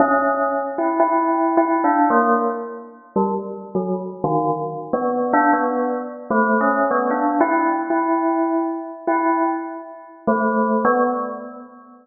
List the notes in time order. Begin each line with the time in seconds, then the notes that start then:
0.00 C#4
0.78 E4
1.00 E4
1.57 E4
1.84 D4
2.10 A#3
3.16 G3
3.75 F#3
4.24 D#3
4.93 B3
5.33 D4
5.53 B3
6.31 A3
6.61 C#4
6.91 B3
7.11 D4
7.41 E4
7.90 E4
9.07 E4
10.27 A3
10.85 B3